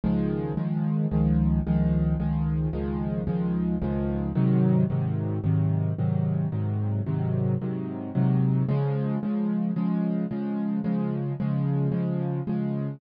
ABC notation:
X:1
M:4/4
L:1/8
Q:1/4=111
K:Db
V:1 name="Acoustic Grand Piano" clef=bass
[D,,E,F,A,]2 [D,,E,F,A,]2 [D,,E,F,A,]2 [D,,E,F,A,]2 | [D,,E,F,A,]2 [D,,E,F,A,]2 [D,,E,F,A,]2 [D,,E,F,A,]2 | [A,,C,E,G,]2 [A,,C,E,G,]2 [A,,C,E,G,]2 [A,,C,E,G,]2 | [A,,C,E,G,]2 [A,,C,E,G,]2 [A,,C,E,G,]2 [A,,C,E,G,]2 |
[D,F,A,]2 [D,F,A,]2 [D,F,A,]2 [D,F,A,]2 | [D,F,A,]2 [D,F,A,]2 [D,F,A,]2 [D,F,A,]2 |]